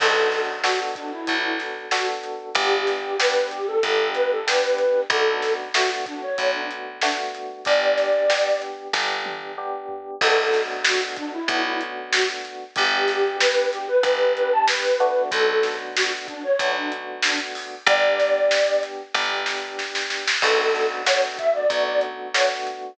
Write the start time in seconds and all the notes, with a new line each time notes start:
0.00 B1 B3 D4 F#4 A4, kick, crash
0.32 snare, closed hi-hat
0.64 B3 D4 F#4 A4, snare
0.95 D4, kick, closed hi-hat
1.12 E4
1.27 B1 B3 D4 F#4 A4, kick, closed hi-hat
1.43 E4
1.59 snare, closed hi-hat
1.91 B3 D4 F#4 A4, snare
2.24 closed hi-hat
2.55 G1 B3 D4 G4, kick, closed hi-hat
2.87 snare, closed hi-hat
3.19 B3 D4 G4 B4, snare
3.51 G4, closed hi-hat
3.67 A4
3.83 G1 B3 D4 G4, kick, closed hi-hat
4.15 B4, snare, closed hi-hat
4.31 A4
4.47 B3 D4 G4 B4, snare
4.78 closed hi-hat
5.10 B1 A3 B3 D4 F#4 A4, kick, closed hi-hat
5.42 snare, closed hi-hat
5.74 A3 B3 D4 F#4, snare
6.06 D4, kick, closed hi-hat
6.22 C#5
6.38 B1 A3 B3 D4 F#4, kick, closed hi-hat
6.54 D4
6.71 closed hi-hat
7.01 A3 B3 D4 F#4, snare
7.35 closed hi-hat
7.65 G1 B3 D4 G4 D5, kick, closed hi-hat
7.97 snare, closed hi-hat
8.30 B3 D4 G4, snare
8.62 closed hi-hat
8.93 G1 B3 D4 G4, kick, snare
9.26 high tom
9.58 B3 D4 G4
9.89 floor tom
10.21 B1 A3 B3 D4 F#4 A4, kick, crash
10.53 snare, closed hi-hat
10.84 F#4, snare
11.16 D4, kick, closed hi-hat
11.33 E4
11.48 B1 A3 B3 D4 F#4, kick, closed hi-hat
11.65 E4
11.81 closed hi-hat
12.13 F#4, snare
12.45 closed hi-hat
12.76 G1 B3 D4 G4, kick, closed hi-hat
13.08 snare, closed hi-hat
13.40 B4, snare
13.72 G4, closed hi-hat
13.88 B4
14.03 G1 B3 D4 G4, kick, closed hi-hat
14.36 B4, closed hi-hat
14.52 A5
14.68 B4, snare
15.00 A3 B3 D4 F#4, closed hi-hat
15.32 B1 A4, kick, closed hi-hat
15.63 snare, closed hi-hat
15.96 F#4, snare
16.28 D4, kick, closed hi-hat
16.43 C#5
16.59 B1 A3 B3 D4 F#4, kick, closed hi-hat
16.76 D4
16.92 closed hi-hat
17.22 D4, snare
17.55 open hi-hat
17.86 G1 B3 D4 G4 D5, kick, closed hi-hat
18.19 snare, closed hi-hat
18.51 snare
18.83 closed hi-hat
19.14 G1 B3 D4 G4, kick, snare
19.46 snare
19.79 snare
19.95 snare
20.10 snare
20.28 snare
20.42 B1 A3 B3 D4 F#4 A4, kick, crash
20.75 snare
21.06 A3 B3 D4 F#4 C#5, snare, closed hi-hat
21.38 E5, kick, closed hi-hat
21.54 D5
21.70 B1 A3 B3 D4 F#4, kick, closed hi-hat
21.86 D5
22.01 closed hi-hat
22.34 A3 B3 D4 F#4 C#5, snare
22.67 closed hi-hat